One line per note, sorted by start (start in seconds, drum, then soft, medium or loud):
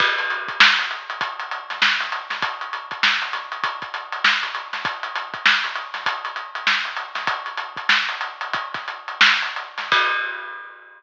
0.00 kick loud
0.00 crash loud
0.18 snare soft
0.18 closed hi-hat medium
0.30 closed hi-hat medium
0.48 kick medium
0.48 closed hi-hat medium
0.60 snare loud
0.79 closed hi-hat medium
0.91 closed hi-hat medium
1.10 closed hi-hat medium
1.21 kick medium
1.21 closed hi-hat loud
1.40 closed hi-hat medium
1.51 closed hi-hat medium
1.70 snare soft
1.70 closed hi-hat medium
1.82 snare loud
2.00 snare soft
2.00 closed hi-hat medium
2.12 closed hi-hat medium
2.30 snare medium
2.30 closed hi-hat medium
2.42 kick loud
2.42 closed hi-hat loud
2.61 closed hi-hat medium
2.73 closed hi-hat medium
2.91 kick medium
2.91 closed hi-hat medium
3.03 snare loud
3.22 closed hi-hat medium
3.33 snare soft
3.33 closed hi-hat medium
3.52 closed hi-hat medium
3.64 kick medium
3.64 closed hi-hat loud
3.82 kick medium
3.82 closed hi-hat medium
3.94 closed hi-hat medium
4.12 closed hi-hat medium
4.24 snare loud
4.43 closed hi-hat medium
4.55 closed hi-hat medium
4.73 snare medium
4.73 closed hi-hat medium
4.85 kick loud
4.85 closed hi-hat loud
5.03 closed hi-hat medium
5.16 closed hi-hat medium
5.34 kick medium
5.34 closed hi-hat medium
5.46 snare loud
5.64 closed hi-hat medium
5.76 closed hi-hat medium
5.94 snare soft
5.94 closed hi-hat medium
6.06 kick medium
6.06 closed hi-hat loud
6.25 closed hi-hat medium
6.36 closed hi-hat medium
6.55 closed hi-hat medium
6.67 snare loud
6.85 closed hi-hat medium
6.97 closed hi-hat medium
7.15 snare medium
7.15 closed hi-hat medium
7.27 kick loud
7.27 closed hi-hat loud
7.46 closed hi-hat medium
7.57 closed hi-hat medium
7.77 kick medium
7.77 closed hi-hat medium
7.89 snare loud
8.08 snare soft
8.08 closed hi-hat medium
8.21 closed hi-hat medium
8.41 closed hi-hat medium
8.53 kick loud
8.53 closed hi-hat loud
8.74 kick medium
8.74 snare soft
8.74 closed hi-hat medium
8.88 closed hi-hat medium
9.08 closed hi-hat medium
9.21 snare loud
9.42 closed hi-hat medium
9.56 closed hi-hat medium
9.78 snare medium
9.78 closed hi-hat medium
9.92 kick loud
9.92 crash loud